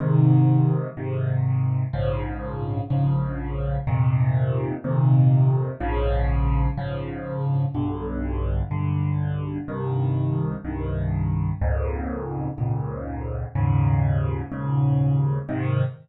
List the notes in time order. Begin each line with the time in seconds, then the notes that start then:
0.00 G#2 C3 D#3
0.97 G#2 C3 D#3
1.93 A#1 G#2 C#3 F3
2.90 A#1 G#2 C#3 F3
3.87 F2 A#2 C3 D#3
4.84 F2 A#2 C3 D#3
5.80 A#1 G#2 C#3 F3
6.77 A#1 G#2 C#3 F3
7.75 B1 G2 D3
8.71 B1 G2 D3
9.68 C2 G2 D#3
10.65 C2 G2 D#3
11.61 C#2 F2 G#2 A#2
12.58 C#2 F2 G#2 A#2
13.55 D#2 G#2 A#2 C#3
14.52 D#2 G#2 A#2 C#3
15.49 G#2 C3 D#3